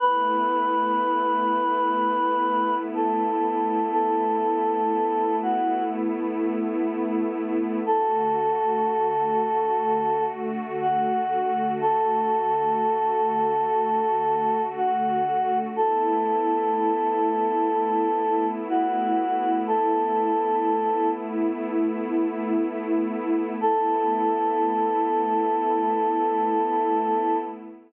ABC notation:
X:1
M:4/4
L:1/8
Q:1/4=61
K:A
V:1 name="Choir Aahs"
B6 A2 | A3 F z4 | A6 F2 | A6 F2 |
A6 F2 | A3 z5 | A8 |]
V:2 name="Pad 2 (warm)"
[A,B,E]8- | [A,B,E]8 | [D,A,F]8- | [D,A,F]8 |
[A,B,E]8- | [A,B,E]8 | [A,B,E]8 |]